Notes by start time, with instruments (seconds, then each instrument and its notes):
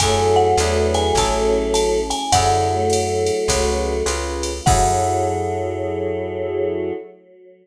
0.00 electric bass (finger) F#2, choir aahs F#3 A3, pad 2 (warm) E4 F#4 G#4 A4, electric piano 1 E4 F#4 G#4 A4, marimba G#5, kick, ride
0.36 marimba F#5
0.57 electric bass (finger) E2, pad 2 (warm) D4 E4 G#4 B4, electric piano 1 D4 E4 G#4 B4, hi-hat pedal, ride
0.94 marimba G#5, ride
1.15 electric bass (finger) A1, pad 2 (warm) C#4 E4 G#4 A4, electric piano 1 C#4 E4 G#4 A4, marimba A5, kick, ride
1.74 marimba A5, hi-hat pedal, ride
2.10 marimba G#5, ride
2.32 electric bass (finger) F#2, choir aahs D3 F#3, pad 2 (warm) E4 F#4 G#4 A4, electric piano 1 E4 F#4 G#4 A4, marimba F#5, kick, ride
2.70 choir aahs F#3 A3
2.90 hi-hat pedal, ride
3.26 ride
3.48 electric bass (finger) C#2, electric piano 1 C#4 F#4 G#4 B4, pad 2 (warm) C#4 F#4 G#4 B4, kick, ride
4.06 electric bass (finger) C#2, electric piano 1 C#4 F4 G#4 B4, pad 2 (warm) C#4 F4 G#4 B4, hi-hat pedal, ride
4.43 ride
4.65 electric bass (finger) F#2, choir aahs F#3, pad 2 (warm) E4 F#4 G#4 A4, electric piano 1 E4 F#4 G#4 A4, marimba F#5, kick, crash